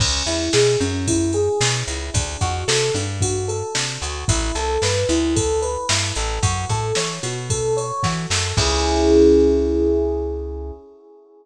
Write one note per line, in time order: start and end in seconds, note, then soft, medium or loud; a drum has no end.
0.00 0.23 C#2 medium
0.00 0.24 C#4 loud
0.00 kick loud
0.00 crash loud
0.26 0.49 E2 medium
0.26 0.50 E4 medium
0.26 ride medium
0.53 0.77 B2 medium
0.53 0.77 G#4 medium
0.53 snare loud
0.80 1.49 F#2 medium
0.80 1.04 C#4 medium
0.80 ride medium
1.08 1.32 E4 medium
1.08 kick medium
1.08 ride loud
1.33 1.58 G#4 medium
1.33 ride medium
1.61 1.83 B2 medium
1.61 1.85 C#4 medium
1.61 snare loud
1.87 2.10 C#2 medium
1.87 2.11 E4 medium
1.87 ride medium
2.14 2.37 D2 medium
2.14 2.38 D4 medium
2.14 kick loud
2.14 ride loud
2.41 2.64 F2 medium
2.41 2.65 F#4 loud
2.41 kick medium
2.41 ride medium
2.68 2.91 C3 medium
2.68 2.92 A4 medium
2.68 snare loud
2.94 3.63 G2 medium
2.94 3.19 D4 medium
2.94 ride medium
3.20 3.46 F#4 loud
3.20 kick medium
3.20 ride loud
3.48 3.72 A4 medium
3.48 ride medium
3.75 3.98 C3 medium
3.75 3.99 D4 medium
3.75 snare loud
4.02 4.25 D2 medium
4.02 4.26 F#4 medium
4.02 ride medium
4.28 4.52 A1 medium
4.28 4.53 E4 loud
4.28 kick loud
4.28 ride loud
4.55 4.78 C2 medium
4.55 4.79 A4 medium
4.55 ride medium
4.82 5.05 G2 medium
4.82 5.07 B4 medium
4.82 snare loud
5.09 5.77 D2 medium
5.09 5.33 E4 medium
5.09 ride medium
5.36 5.60 A4 loud
5.36 kick loud
5.36 ride loud
5.62 5.86 B4 medium
5.62 ride medium
5.89 6.12 G2 medium
5.89 6.14 E4 medium
5.89 snare loud
6.15 6.39 A1 medium
6.15 6.40 A4 medium
6.15 ride medium
6.43 6.65 F#2 medium
6.43 6.67 F#4 loud
6.43 kick loud
6.43 ride loud
6.69 6.92 A2 medium
6.69 6.94 A4 medium
6.69 kick medium
6.69 ride medium
6.95 7.19 E3 medium
6.95 7.21 C#5 medium
6.95 snare loud
7.23 7.92 B2 medium
7.23 7.47 F#4 medium
7.23 ride medium
7.50 7.74 A4 loud
7.50 kick medium
7.50 ride loud
7.77 8.01 C#5 medium
7.77 ride medium
8.03 8.26 E3 medium
8.03 8.27 F#4 medium
8.03 kick medium
8.03 snare medium
8.30 8.53 F#2 medium
8.30 8.55 A4 medium
8.30 snare loud
8.57 10.72 C#2 loud
8.57 10.72 C#4 loud
8.57 10.72 E4 loud
8.57 10.72 G#4 loud
8.57 kick loud
8.57 crash loud